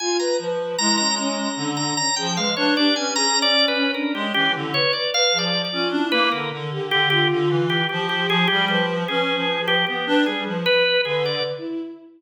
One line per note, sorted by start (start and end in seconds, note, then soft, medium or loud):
0.00 0.17 F4 loud
0.00 0.17 G#5 medium
0.19 0.37 B4 loud
0.19 0.37 A#5 medium
0.39 0.75 F3 medium
0.39 0.58 B4 medium
0.59 0.77 B4 medium
0.78 1.49 G#3 medium
0.78 0.97 E4 medium
0.78 0.96 A#5 loud
0.98 1.16 C#4 medium
0.98 1.15 A#5 loud
1.18 1.36 C#4 loud
1.18 1.71 A#5 soft
1.38 1.56 C#4 medium
1.57 1.92 D3 medium
1.57 1.94 D4 medium
1.77 1.94 A#5 medium
1.97 2.15 C#4 medium
1.97 2.15 A#5 loud
2.16 2.37 F3 medium
2.16 2.35 G#4 medium
2.16 2.34 G5 medium
2.36 2.53 G#3 medium
2.36 2.55 B4 medium
2.36 2.55 F5 medium
2.57 2.75 D4 loud
2.57 2.74 B4 medium
2.57 2.74 C#5 medium
2.76 2.94 D4 loud
2.76 2.94 G4 medium
2.76 2.95 D5 medium
2.96 3.85 C#4 medium
2.96 3.14 B4 medium
2.96 3.14 G#5 medium
3.16 3.34 G#4 loud
3.16 3.39 A#5 loud
3.36 3.53 C#4 medium
3.42 3.66 D5 loud
3.55 3.72 C#4 medium
3.68 3.92 B4 medium
3.75 3.93 C#4 loud
3.94 4.12 D4 medium
3.94 4.12 A#4 medium
4.14 4.32 G#3 medium
4.14 4.32 C#4 medium
4.14 4.33 G4 medium
4.34 4.53 E3 medium
4.34 4.52 C#4 medium
4.34 4.52 G4 loud
4.54 4.72 D3 medium
4.54 4.72 E4 medium
4.74 4.92 B4 medium
4.74 4.92 C#5 loud
4.93 5.12 B4 medium
4.93 5.11 D5 medium
5.13 5.31 B4 loud
5.13 5.38 F5 loud
5.32 5.68 F3 medium
5.32 5.50 G#4 medium
5.38 5.62 D5 medium
5.65 5.88 D5 medium
5.72 5.90 C#4 medium
5.72 5.90 F4 medium
5.90 6.08 D4 medium
5.90 6.28 E4 medium
6.12 6.29 A#3 loud
6.12 6.29 B4 loud
6.32 6.50 D3 medium
6.32 6.50 A#4 medium
6.32 6.67 A#4 medium
6.52 6.70 D3 medium
6.71 6.89 D3 medium
6.71 7.07 G4 loud
6.90 7.26 D3 medium
6.90 7.09 G4 loud
7.10 7.63 F4 loud
7.10 7.28 G4 loud
7.31 7.49 D3 medium
7.49 7.84 E3 medium
7.70 7.87 G4 medium
7.89 8.27 F3 medium
7.89 8.07 G4 medium
7.89 8.43 G4 loud
8.09 8.27 G4 medium
8.28 8.46 F3 medium
8.28 8.47 G#4 loud
8.48 8.69 G3 medium
8.48 8.65 G4 loud
8.48 8.67 G#4 medium
8.68 9.04 F3 medium
8.68 8.86 G4 medium
8.68 9.04 B4 medium
9.08 9.33 C#4 medium
9.08 9.62 G#4 medium
9.08 9.79 B4 medium
9.35 9.59 F3 medium
9.60 9.83 F3 medium
9.68 9.85 G4 loud
9.87 10.05 B3 medium
9.87 10.22 G4 medium
9.87 10.05 B4 medium
10.06 10.24 D4 loud
10.06 10.24 B4 loud
10.26 10.44 G3 medium
10.26 10.44 G#4 medium
10.46 10.64 F3 medium
10.46 10.64 B4 medium
10.66 11.01 B4 loud
10.66 10.84 B4 loud
10.85 11.03 B4 medium
11.05 11.40 D3 medium
11.05 11.23 G#4 medium
11.05 11.29 B4 loud
11.25 11.43 D5 medium
11.32 11.55 B4 medium
11.58 11.81 E4 medium